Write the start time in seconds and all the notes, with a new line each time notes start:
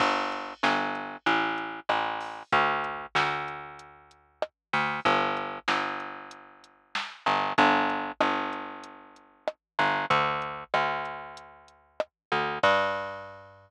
0.00 G1, kick, crash
0.32 closed hi-hat
0.63 G1, snare
0.95 closed hi-hat
1.26 A1, closed hi-hat
1.58 closed hi-hat
1.89 A1, cross-stick
2.20 open hi-hat
2.52 D2, kick, closed hi-hat
2.84 closed hi-hat
3.15 D2, snare
3.48 closed hi-hat
3.79 closed hi-hat
4.11 closed hi-hat
4.42 cross-stick
4.73 D2, open hi-hat
5.05 G1, kick, closed hi-hat
5.37 closed hi-hat
5.68 G1, snare
6.00 closed hi-hat
6.31 closed hi-hat
6.64 closed hi-hat
6.95 snare
7.26 G1, closed hi-hat
7.58 G1, kick, closed hi-hat
7.90 closed hi-hat
8.21 G1, cross-stick
8.53 closed hi-hat
8.84 closed hi-hat
9.16 closed hi-hat
9.48 cross-stick
9.79 G1, closed hi-hat
10.10 D2, kick, closed hi-hat
10.42 closed hi-hat
10.74 D2, cross-stick
11.05 closed hi-hat
11.37 closed hi-hat
11.68 closed hi-hat
12.00 cross-stick
12.32 D2, closed hi-hat
12.63 G2, kick, crash